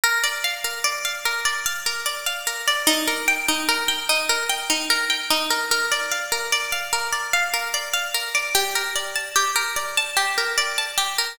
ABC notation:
X:1
M:7/8
L:1/8
Q:1/4=148
K:Bbmix
V:1 name="Pizzicato Strings"
B d f B d f B | d f B d f B d | E B g E B g E | B g E B g E B |
B d f B d f B | d f B d f B d | G B d =a G B d | =a G B d a G B |]